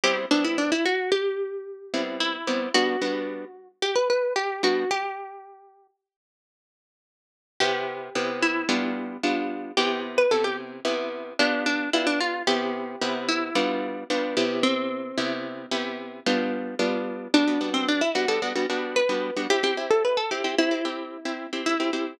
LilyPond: <<
  \new Staff \with { instrumentName = "Acoustic Guitar (steel)" } { \time 5/4 \key g \major \tempo 4 = 111 g'16 r16 d'16 e'16 d'16 e'16 fis'8 g'2 e'4 | \time 4/4 fis'2 g'16 b'16 b'8 g'8 fis'8 | \time 5/4 g'2 r2. | \time 4/4 \key c \major g'4. e'4. r4 |
\time 5/4 g'8 r16 b'16 a'16 g'16 r4. d'8 d'8 e'16 d'16 f'8 | \time 4/4 g'4. e'4. r4 | \time 5/4 c'2. r2 | \time 4/4 \key g \major d'8. c'16 d'16 e'16 fis'16 a'16 r4 b'4 |
\time 5/4 g'16 g'16 r16 a'16 b'16 a'16 g'8 e'2 e'4 | }
  \new Staff \with { instrumentName = "Acoustic Guitar (steel)" } { \time 5/4 \key g \major <g b c' e'>8 <g b c' e'>2. <g b c' e'>4 <g b c' e'>8 | \time 4/4 <g b d'>8 <g b d' fis'>2. <g b d'>8 | \time 5/4 r1 r4 | \time 4/4 \key c \major <c b e'>4 <c b e' g'>4 <g b d' f'>4 <g b d' f'>4 |
\time 5/4 <c b e'>4 <c b e' g'>4 <c b e' g'>4 <b f' g'>4 <b d' f' g'>4 | \time 4/4 <c b e'>4 <c b e' g'>4 <g b d' f'>4 <g b d' f'>8 <c b e' g'>8~ | \time 5/4 <c b e' g'>4 <c b e' g'>4 <c b e' g'>4 <g b d' f'>4 <g b d' f'>4 | \time 4/4 \key g \major <g b fis'>16 <g b d' fis'>16 <g b d' fis'>4 <g b d'>16 <g b d' fis'>16 <g b d' fis'>16 <g b d' fis'>16 <g b d' fis'>8. <g b d' fis'>8 <g b d' fis'>16 |
\time 5/4 <c' e'>16 <c' e'>16 <c' e' g'>4 <c' e'>16 <c' e' g'>16 <c' g'>16 <c' e' g'>16 <c' e' g'>8. <c' e' g'>8 <c' e' g'>8 <c' e' g'>16 <c' e' g'>8 | }
>>